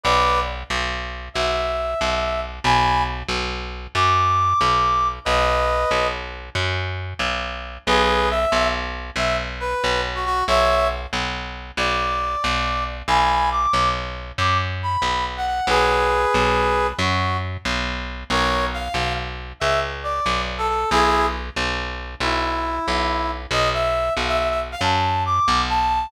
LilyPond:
<<
  \new Staff \with { instrumentName = "Brass Section" } { \time 12/8 \key b \major \tempo 4. = 92 <b' d''>4 r2 e''2. | <gis'' b''>4 r2 d'''2. | <b' dis''>2 r1 | <gis' b'>4 e''4 r4 e''8 r8 b'4 r16 fis'16 fis'8 |
<cis'' e''>4 r2 d''2. | <gis'' b''>4 d'''4 r4 d'''8 r8 b''4 r16 fis''16 fis''8 | <gis' b'>2. fis'4 r2 | <ais' cis''>4 f''4 r4 e''8 r8 d''4 r16 a'16 a'8 |
<e' gis'>4 r2 e'2. | dis''8 e''4 f''16 e''16 e''16 e''16 r16 f''16 a''4 d'''4 a''4 | }
  \new Staff \with { instrumentName = "Electric Bass (finger)" } { \clef bass \time 12/8 \key b \major b,,4. b,,4. b,,4. b,,4. | b,,4. b,,4. fis,4. b,,4. | b,,4. b,,4. fis,4. b,,4. | b,,4. b,,4. b,,4. b,,4. |
b,,4. b,,4. b,,4. b,,4. | b,,4. b,,4. fis,4. b,,4. | b,,4. b,,4. fis,4. b,,4. | b,,4. b,,4. cis,4. b,,4. |
b,,4. b,,4. b,,4. b,,4. | b,,4. b,,4. fis,4. b,,4. | }
>>